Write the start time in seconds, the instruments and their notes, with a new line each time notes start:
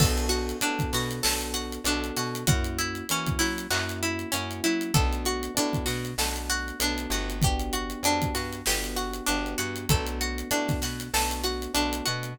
0.00 electric bass (finger) B1, electric piano 1 B3 D4 F#4 A4, pizzicato strings A4, kick, crash
0.18 closed hi-hat
0.29 pizzicato strings F#4, closed hi-hat
0.49 closed hi-hat
0.61 electric bass (finger) A2, electric piano 1 B3 D4 F#4 A4, pizzicato strings D4, closed hi-hat
0.79 kick, closed hi-hat
0.93 electric bass (finger) B2, pizzicato strings F#4, snare, closed hi-hat
1.11 closed hi-hat
1.23 electric bass (finger) B1, electric piano 1 B3 D4 F#4 A4, pizzicato strings A4, snare
1.41 closed hi-hat
1.54 pizzicato strings F#4, closed hi-hat
1.72 closed hi-hat
1.84 electric bass (finger) B1, electric piano 1 B3 D4 F#4 A4, pizzicato strings D4, closed hi-hat
2.04 closed hi-hat
2.16 electric bass (finger) B2, pizzicato strings F#4, snare, closed hi-hat
2.35 closed hi-hat
2.47 electric bass (finger) F#2, electric piano 1 A#3 C#4 E4 F#4, pizzicato strings F#4, kick, closed hi-hat
2.64 closed hi-hat
2.78 pizzicato strings E4, closed hi-hat
2.95 closed hi-hat
3.09 electric bass (finger) E3, electric piano 1 A#3 C#4 E4 F#4, pizzicato strings C#4, closed hi-hat
3.26 kick, closed hi-hat
3.39 electric bass (finger) F#3, pizzicato strings E4, snare, closed hi-hat
3.58 closed hi-hat
3.70 electric bass (finger) F#2, electric piano 1 A#3 C#4 E4 F#4, pizzicato strings F#4, clap
3.89 closed hi-hat
4.03 pizzicato strings E4, closed hi-hat
4.19 closed hi-hat
4.32 electric bass (finger) F#2, electric piano 1 A#3 C#4 E4 F#4, pizzicato strings C#4, closed hi-hat
4.51 closed hi-hat
4.64 electric bass (finger) F#3, pizzicato strings E4, closed hi-hat
4.81 closed hi-hat
4.94 electric bass (finger) B1, electric piano 1 A3 B3 D4 F#4, pizzicato strings A4, kick, closed hi-hat
5.13 closed hi-hat
5.25 pizzicato strings F#4, closed hi-hat
5.43 closed hi-hat
5.55 electric bass (finger) A2, electric piano 1 A3 B3 D4 F#4, pizzicato strings D4, closed hi-hat
5.73 kick, closed hi-hat
5.86 electric bass (finger) B2, pizzicato strings F#4, snare, closed hi-hat
6.05 closed hi-hat
6.18 electric bass (finger) B1, electric piano 1 A3 B3 D4 F#4, pizzicato strings A4, snare
6.36 closed hi-hat
6.50 pizzicato strings F#4, closed hi-hat
6.68 closed hi-hat
6.80 electric bass (finger) B1, electric piano 1 A3 B3 D4 F#4, pizzicato strings D4, closed hi-hat
6.98 closed hi-hat
7.10 electric bass (finger) G1, pizzicato strings F#4, closed hi-hat
7.30 closed hi-hat
7.42 electric piano 1 B3 D4 F#4 G4, pizzicato strings G4, kick, closed hi-hat
7.59 closed hi-hat
7.73 pizzicato strings F#4, closed hi-hat
7.90 closed hi-hat
8.03 electric bass (finger) F2, electric piano 1 B3 D4 F#4 G4, pizzicato strings D4, closed hi-hat
8.22 kick, closed hi-hat
8.35 electric bass (finger) G2, pizzicato strings F#4, snare, closed hi-hat
8.53 closed hi-hat
8.66 electric bass (finger) G1, electric piano 1 B3 D4 F#4 G4, pizzicato strings G4, snare
8.84 closed hi-hat
8.96 pizzicato strings F#4, closed hi-hat
9.13 closed hi-hat
9.26 electric bass (finger) G1, electric piano 1 B3 D4 F#4 G4, pizzicato strings D4, closed hi-hat
9.46 closed hi-hat
9.58 electric bass (finger) G2, pizzicato strings F#4, closed hi-hat
9.76 closed hi-hat
9.89 electric bass (finger) B1, electric piano 1 A3 B3 D4 F#4, pizzicato strings A4, kick, closed hi-hat
10.07 closed hi-hat
10.21 pizzicato strings F#4, closed hi-hat
10.38 closed hi-hat
10.51 electric bass (finger) A2, electric piano 1 A3 B3 D4 F#4, pizzicato strings D4, closed hi-hat
10.68 kick, snare, closed hi-hat
10.82 electric bass (finger) B2, pizzicato strings F#4, snare, closed hi-hat
11.00 closed hi-hat
11.14 electric bass (finger) B1, electric piano 1 A3 B3 D4 F#4, pizzicato strings A4, snare
11.31 closed hi-hat
11.44 pizzicato strings F#4, closed hi-hat
11.62 closed hi-hat
11.74 electric bass (finger) B1, electric piano 1 A3 B3 D4 F#4, pizzicato strings D4, closed hi-hat
11.93 closed hi-hat
12.06 electric bass (finger) B2, pizzicato strings F#4, closed hi-hat
12.23 closed hi-hat